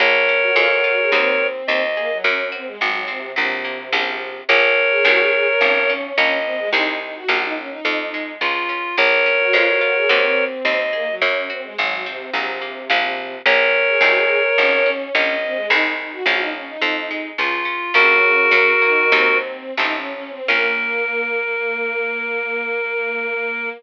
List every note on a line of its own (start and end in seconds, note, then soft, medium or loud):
0.00 0.52 A#1 loud
0.00 0.53 A#3 medium
0.00 1.47 A#4 loud
0.00 1.47 C#5 loud
0.29 0.55 C#4 medium
0.42 0.55 F#4 medium
0.56 1.07 F2 loud
0.56 1.09 G#3 loud
0.56 0.69 F4 medium
0.71 0.84 F#4 medium
0.84 1.11 F4 medium
0.84 0.98 F#4 medium
0.98 1.11 G#4 medium
1.12 1.63 D#2 loud
1.12 1.82 C4 medium
1.12 1.63 C4 medium
1.12 1.63 D#4 medium
1.12 1.63 F#4 loud
1.67 2.20 D#2 loud
1.67 2.23 C4 loud
1.67 2.18 D#5 loud
1.97 2.10 A#3 medium
1.97 2.24 G#4 medium
2.11 2.24 F#3 medium
2.24 2.76 F#2 loud
2.24 2.78 A#3 medium
2.24 2.49 C#4 medium
2.52 2.66 C4 medium
2.52 2.79 F#4 medium
2.66 2.79 G#3 medium
2.79 3.33 G#1 loud
2.79 3.05 F#3 medium
2.79 3.34 G#3 medium
3.08 3.33 C3 medium
3.08 3.34 C4 medium
3.36 3.89 A#1 loud
3.36 4.38 C3 medium
3.36 3.89 F#3 medium
3.65 3.91 A#3 medium
3.92 4.44 A#1 loud
3.92 4.43 F3 loud
3.92 4.43 A#3 medium
3.92 4.43 C#4 medium
4.49 5.01 A#1 loud
4.49 4.99 F3 medium
4.49 4.99 A#3 loud
4.49 4.99 C#4 medium
4.49 5.93 A#4 loud
4.49 5.93 C#5 loud
4.90 5.04 G#4 medium
5.05 5.57 C2 loud
5.05 5.55 D#3 loud
5.05 5.55 G#3 loud
5.05 5.55 C4 medium
5.05 5.18 F#4 medium
5.19 5.32 G#4 medium
5.33 5.46 G#4 medium
5.47 5.60 A#4 medium
5.61 6.13 G#1 loud
5.61 6.14 F3 medium
5.61 6.38 C#4 medium
5.89 6.16 C#4 medium
6.17 6.69 A#1 loud
6.17 6.68 F3 medium
6.17 6.68 A#3 medium
6.17 6.68 C#4 loud
6.17 6.69 D#5 medium
6.45 6.58 C4 medium
6.58 6.72 G#3 medium
6.72 7.24 C2 loud
6.72 7.24 D#3 medium
6.72 7.24 G#3 loud
6.72 7.24 C4 medium
6.72 6.96 D#4 loud
7.01 7.15 D#4 medium
7.16 7.29 F#4 medium
7.29 7.80 A#1 loud
7.29 7.79 F3 loud
7.29 7.79 A#3 loud
7.29 7.79 C#4 loud
7.29 7.42 F#4 medium
7.43 7.56 D#4 medium
7.57 7.70 C#4 medium
7.70 8.32 D#4 medium
7.85 8.36 F2 loud
7.85 8.38 F3 loud
8.14 8.41 G#3 medium
8.41 8.93 C#2 loud
8.41 8.94 F3 medium
8.41 8.96 F4 loud
8.69 8.96 C#4 medium
8.97 9.49 A#1 loud
8.97 9.25 A#3 medium
8.97 10.45 A#4 loud
8.97 10.45 C#5 loud
9.26 9.53 C#4 medium
9.40 9.53 F#4 medium
9.53 10.05 F2 loud
9.53 9.81 G#3 loud
9.53 9.66 F4 medium
9.66 9.80 F#4 medium
9.81 10.08 F4 medium
9.81 9.95 F#4 medium
9.95 10.09 G#4 medium
10.09 10.62 D#2 loud
10.09 10.80 C4 medium
10.09 10.60 C4 medium
10.09 10.60 D#4 medium
10.09 10.60 F#4 loud
10.64 11.16 D#2 loud
10.64 10.93 C4 loud
10.64 11.15 D#5 loud
10.93 11.07 A#3 medium
10.93 11.20 G#4 medium
11.08 11.21 F#3 medium
11.21 11.73 F#2 loud
11.21 11.50 A#3 medium
11.21 11.46 C#4 medium
11.50 11.63 C4 medium
11.50 11.76 F#4 medium
11.63 11.76 G#3 medium
11.78 12.30 G#1 loud
11.78 12.03 F#3 medium
11.78 12.06 G#3 medium
12.06 12.31 C3 medium
12.06 12.33 C4 medium
12.33 12.85 A#1 loud
12.33 13.35 C3 medium
12.33 12.63 F#3 medium
12.61 12.88 A#3 medium
12.90 13.42 A#1 loud
12.90 13.40 F3 loud
12.90 13.40 A#3 medium
12.90 13.40 C#4 medium
13.46 13.97 A#1 loud
13.46 13.96 F3 medium
13.46 13.96 A#3 loud
13.46 13.96 C#4 medium
13.46 14.91 A#4 loud
13.46 14.91 C#5 loud
13.88 14.01 G#4 medium
14.01 14.52 C2 loud
14.01 14.52 D#3 loud
14.01 14.52 G#3 loud
14.01 14.52 C4 medium
14.01 14.15 F#4 medium
14.15 14.29 G#4 medium
14.29 14.43 G#4 medium
14.44 14.57 A#4 medium
14.58 15.10 G#1 loud
14.58 14.86 F3 medium
14.58 15.35 C#4 medium
14.86 15.13 C#4 medium
15.14 15.66 A#1 loud
15.14 15.65 F3 medium
15.14 15.65 A#3 medium
15.14 15.65 C#4 loud
15.14 15.67 D#5 medium
15.42 15.55 C4 medium
15.56 15.69 G#3 medium
15.69 16.22 C2 loud
15.69 16.21 D#3 medium
15.69 16.21 G#3 loud
15.69 16.21 C4 medium
15.69 15.93 D#4 loud
15.98 16.11 D#4 medium
16.12 16.25 F#4 medium
16.26 16.77 A#1 loud
16.26 16.77 F3 loud
16.26 16.77 A#3 loud
16.26 16.77 C#4 loud
16.26 16.40 F#4 medium
16.39 16.53 D#4 medium
16.54 16.68 C#4 medium
16.67 17.29 D#4 medium
16.82 17.33 F2 loud
16.82 17.10 F3 loud
17.11 17.37 G#3 medium
17.38 17.90 C#2 loud
17.38 17.66 F3 medium
17.38 17.93 F4 loud
17.65 17.92 C#4 medium
17.94 18.48 A#1 loud
17.94 18.71 C#3 medium
17.94 18.46 F3 medium
17.94 18.46 A#3 medium
17.94 18.46 C#4 medium
17.94 19.38 F#4 loud
17.94 19.38 A#4 loud
18.51 19.07 F#2 loud
18.51 19.10 F#3 medium
18.82 19.11 D#3 medium
18.82 19.11 A#3 medium
19.12 19.72 D#2 loud
19.12 19.71 F#3 loud
19.12 19.71 C4 loud
19.12 19.73 C4 medium
19.12 19.71 D#4 loud
19.77 20.41 A1 loud
19.77 20.42 F3 medium
19.77 20.42 A3 medium
19.77 20.42 C4 loud
19.77 19.94 D#4 medium
19.77 20.42 D#4 loud
19.95 20.11 C#4 medium
20.13 20.30 C#4 medium
20.30 20.47 C4 medium
20.48 23.71 A#1 loud
20.48 23.69 A#3 medium
20.48 23.70 A#3 loud
20.48 23.69 C#4 loud
20.48 23.69 F4 loud
20.48 23.69 A#4 loud